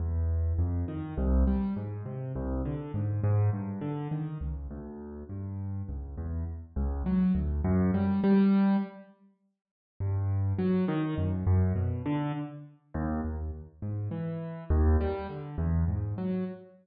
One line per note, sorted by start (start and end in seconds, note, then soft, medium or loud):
0.00 0.53 E2 medium
0.59 0.85 F2 medium
0.88 1.14 D#3 medium
1.17 1.44 C2 loud
1.47 1.74 G3 medium
1.76 2.03 G#2 medium
2.06 2.32 C3 medium
2.36 2.62 C2 loud
2.65 2.92 D3 medium
2.94 3.21 G#2 medium
3.24 3.50 G#2 loud
3.53 3.79 G2 medium
3.81 4.08 D3 medium
4.12 4.38 D#3 medium
4.41 4.67 C#2 medium
4.71 5.24 D2 medium
5.29 5.82 G2 medium
5.89 6.15 C#2 medium
6.17 6.44 E2 medium
6.76 7.03 C#2 medium
7.06 7.33 F#3 medium
7.35 7.61 D2 medium
7.64 7.91 F#2 loud
7.94 8.21 G3 medium
8.24 8.76 G3 loud
10.00 10.53 G2 medium
10.59 10.85 F#3 medium
10.88 11.15 D#3 loud
11.18 11.44 F#2 medium
11.47 11.73 F#2 loud
11.75 12.02 B2 medium
12.06 12.32 D3 loud
12.94 13.21 D#2 loud
13.25 13.51 D#2 medium
13.82 14.09 G#2 medium
14.11 14.64 E3 medium
14.70 14.97 D#2 loud
15.01 15.27 G3 medium
15.29 15.56 D3 medium
15.58 15.85 E2 loud
15.88 16.14 G#2 medium
16.18 16.44 F#3 medium